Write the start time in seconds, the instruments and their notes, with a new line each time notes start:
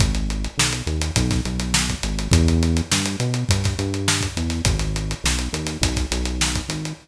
0.00 synth bass 1 G#1, kick, closed hi-hat
0.15 closed hi-hat
0.30 closed hi-hat
0.44 closed hi-hat
0.58 synth bass 1 B1, snare
0.73 closed hi-hat
0.87 synth bass 1 D#2, closed hi-hat
1.01 closed hi-hat
1.16 synth bass 1 B1, kick, closed hi-hat
1.31 kick, snare, closed hi-hat
1.45 synth bass 1 B1, closed hi-hat
1.59 snare, closed hi-hat
1.74 snare
1.89 kick, snare, closed hi-hat
2.03 synth bass 1 G#1, closed hi-hat
2.19 closed hi-hat
2.31 synth bass 1 E2, kick, closed hi-hat
2.48 closed hi-hat
2.63 closed hi-hat
2.77 closed hi-hat
2.92 synth bass 1 G2, snare
3.05 closed hi-hat
3.20 synth bass 1 B2, closed hi-hat
3.34 closed hi-hat
3.49 synth bass 1 G2, kick, closed hi-hat
3.64 kick, snare, closed hi-hat
3.79 synth bass 1 G2, closed hi-hat
3.94 closed hi-hat
4.08 snare
4.21 kick, snare, closed hi-hat
4.37 synth bass 1 E2, closed hi-hat
4.50 snare, closed hi-hat
4.65 synth bass 1 G#1, kick, closed hi-hat
4.79 snare, closed hi-hat
4.96 closed hi-hat
5.11 closed hi-hat
5.24 synth bass 1 B1, snare
5.39 closed hi-hat
5.53 synth bass 1 D#2, closed hi-hat
5.67 snare, closed hi-hat
5.81 synth bass 1 B1, kick, closed hi-hat
5.96 kick, snare, closed hi-hat
6.11 synth bass 1 B1, closed hi-hat
6.25 closed hi-hat
6.41 snare
6.55 kick, closed hi-hat
6.68 synth bass 1 G#1, snare, closed hi-hat
6.85 closed hi-hat